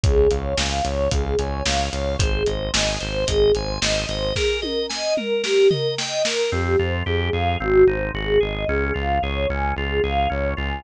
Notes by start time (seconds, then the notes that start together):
0.03 C#2 G#4 C#5, kick, closed hi-hat
0.31 C#2 C#5 F5, closed hi-hat
0.57 C#2 F5 G#5, snare
0.85 C#2 C#5, closed hi-hat
1.11 C#2 G#4 F5, kick, closed hi-hat
1.38 C#2 C#5 G#5, closed hi-hat
1.65 C#2 C#5 F5, snare
1.92 C#2 C#5 F5, closed hi-hat
2.19 G#1 G#4 C5, kick, closed hi-hat
2.46 G#1 C5 D#5, closed hi-hat
2.73 G#1 D#5 G#5, snare
3.00 G#1 C5, closed hi-hat
3.27 G#1 G#4 D#5, kick, closed hi-hat
3.55 G#1 C5 G#5, closed hi-hat
3.81 G#1 C5 D#5, snare
4.09 G#1 C5 D#5, closed hi-hat
4.35 G#4 A#4, kick, snare
4.62 A#4 D#5, high tom
4.89 D#5 G#5, snare
5.17 A#4, mid tom
5.43 G4 A#4, snare
5.70 A#4 D#5, floor tom
5.98 D#5 G5, snare
6.25 A#4, snare
6.52 F2 C4 G4
6.79 F2 F4 C5
7.06 F2 G4 G#4
7.33 F2 G#4 F5
7.60 G#1 C4 F#4
7.87 G#1 D#4 C5
8.14 G#1 F#4 G#4
8.40 G#1 G#4 D#5
8.68 C#2 C#4 G#4
8.94 C#2 F4 F5
9.22 C#2 G#4 C#5
9.49 C#2 C#4 G#5
9.76 C#2 F4 G#4
10.03 C#2 G#4 F5
10.30 C#2 C#4 C#5
10.57 C#2 F4 G#5